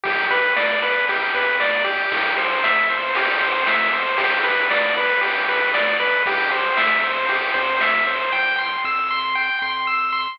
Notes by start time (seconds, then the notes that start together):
0.04 B1 G4, kick, ride
0.30 B4, kick, ride
0.56 E2 D5, snare
0.83 B4, ride
1.08 G4, kick, ride
1.34 E2 B4, ride
1.60 D5, snare
1.84 G4, kick, ride
2.12 C2, kick, ride
2.38 C5, kick, ride
2.64 F2 E5, snare
2.89 C5, kick, ride
3.15 G4, kick, ride
3.41 F2 C5, ride
3.67 E5, snare
3.93 C5, ride
4.18 G1 G4, kick, ride
4.44 B4, kick, ride
4.70 C2 D5, snare
4.96 B4, kick, ride
5.21 G4, kick, ride
5.48 C2 B4, ride
5.74 D2 D5, snare
6.00 C#2 B4, kick, ride
6.26 C2 G4, kick, ride
6.51 C5, kick, ride
6.77 F2 E5, snare
7.03 C5, kick, ride
7.29 G4, kick, ride
7.54 F2 C5, ride
7.80 E5, snare
8.06 C5, ride
8.32 C2 G5
8.58 C6
8.84 F2 E6
9.11 C6
9.35 G5
9.62 F2 C6
9.87 E6
10.12 C6